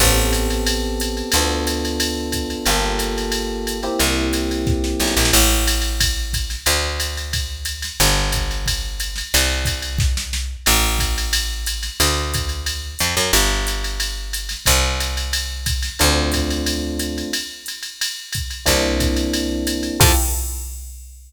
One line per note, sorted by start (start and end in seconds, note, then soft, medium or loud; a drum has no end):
0.00 1.23 A1 medium
0.00 1.31 B3 medium
0.00 1.31 C4 medium
0.00 1.31 G4 medium
0.00 1.31 A4 medium
0.00 kick medium
0.00 crash medium
0.00 ride medium
0.33 hi-hat pedal medium
0.33 ride medium
0.50 ride medium
0.67 ride medium
1.00 hi-hat pedal medium
1.00 ride medium
1.17 ride medium
1.32 2.56 D2 medium
1.32 2.65 B3 medium
1.32 2.65 D4 medium
1.32 2.65 F4 medium
1.32 2.65 A4 medium
1.32 ride loud
1.67 hi-hat pedal medium
1.67 ride medium
1.85 ride medium
2.00 ride loud
2.32 kick soft
2.32 hi-hat pedal medium
2.32 ride medium
2.50 ride medium
2.66 3.89 G1 medium
2.66 3.78 A#3 medium
2.66 3.78 F4 medium
2.66 3.78 G4 medium
2.66 3.78 A4 medium
2.66 ride medium
2.99 hi-hat pedal medium
2.99 ride medium
3.18 ride medium
3.32 ride medium
3.67 hi-hat pedal medium
3.67 ride medium
3.83 5.31 A#3 medium
3.83 5.31 C4 medium
3.83 5.31 E4 medium
3.83 5.31 G4 medium
3.83 ride medium
3.99 4.95 C2 medium
3.99 ride medium
4.33 hi-hat pedal medium
4.33 ride medium
4.51 ride medium
4.67 kick medium
4.67 snare medium
4.84 snare medium
5.00 5.15 B1 medium
5.00 snare medium
5.07 snare medium
5.17 5.32 A#1 medium
5.17 snare medium
5.25 snare medium
5.33 6.56 A1 medium
5.33 crash medium
5.33 ride medium
5.67 hi-hat pedal medium
5.67 ride medium
5.82 ride medium
6.00 kick medium
6.00 ride loud
6.33 kick medium
6.33 hi-hat pedal medium
6.33 ride medium
6.50 snare medium
6.50 ride medium
6.66 7.89 D2 medium
6.66 ride medium
7.00 hi-hat pedal medium
7.00 ride medium
7.17 ride medium
7.33 kick medium
7.33 ride medium
7.65 hi-hat pedal medium
7.65 ride medium
7.82 snare medium
7.82 ride medium
8.00 9.23 G1 medium
8.00 ride medium
8.32 kick medium
8.32 hi-hat pedal medium
8.32 ride medium
8.51 ride medium
8.66 kick medium
8.66 ride medium
9.00 hi-hat pedal medium
9.00 ride medium
9.16 snare medium
9.16 ride medium
9.34 10.57 C2 medium
9.34 ride loud
9.65 kick medium
9.65 hi-hat pedal medium
9.65 ride medium
9.82 ride medium
9.98 kick medium
9.98 snare medium
10.17 snare medium
10.33 snare medium
10.66 11.90 A1 medium
10.66 crash medium
10.66 ride medium
10.99 kick medium
10.99 hi-hat pedal medium
10.99 ride medium
11.18 ride medium
11.33 ride loud
11.66 hi-hat pedal medium
11.66 ride medium
11.83 snare soft
11.83 ride medium
12.00 12.95 D2 medium
12.00 ride loud
12.34 kick medium
12.34 hi-hat pedal medium
12.34 ride medium
12.49 ride medium
12.66 ride medium
12.99 13.15 F2 medium
12.99 hi-hat pedal medium
12.99 ride medium
13.17 13.32 F#2 medium
13.17 snare soft
13.17 ride medium
13.33 14.56 G1 medium
13.33 ride loud
13.67 hi-hat pedal medium
13.67 ride medium
13.84 ride medium
14.00 ride medium
14.33 hi-hat pedal medium
14.33 ride medium
14.49 snare medium
14.49 ride medium
14.66 15.90 C2 medium
14.66 kick medium
14.66 ride medium
15.00 hi-hat pedal medium
15.00 ride medium
15.17 ride medium
15.33 ride medium
15.66 kick medium
15.66 hi-hat pedal medium
15.66 ride medium
15.82 snare medium
15.82 ride medium
15.99 17.23 D2 medium
15.99 17.30 A3 medium
15.99 17.30 C4 medium
15.99 17.30 D4 medium
15.99 17.30 F4 medium
15.99 ride medium
16.32 kick soft
16.32 hi-hat pedal medium
16.32 ride medium
16.50 ride medium
16.66 ride medium
16.99 hi-hat pedal medium
16.99 ride medium
17.18 ride medium
17.33 ride medium
17.66 hi-hat pedal medium
17.66 ride medium
17.83 ride medium
18.01 ride medium
18.32 kick medium
18.32 hi-hat pedal medium
18.32 ride medium
18.50 ride medium
18.66 19.90 C2 medium
18.66 19.96 A#3 medium
18.66 19.96 C4 medium
18.66 19.96 D4 medium
18.66 19.96 E4 medium
18.66 kick medium
18.66 ride medium
19.00 kick medium
19.00 hi-hat pedal medium
19.00 ride medium
19.16 ride medium
19.33 ride medium
19.67 hi-hat pedal medium
19.67 ride medium
19.83 ride medium
20.00 20.12 F2 loud
20.00 20.11 E4 medium
20.00 20.11 F4 medium
20.00 20.11 G4 loud
20.00 20.11 A4 loud
20.00 kick loud
20.00 crash loud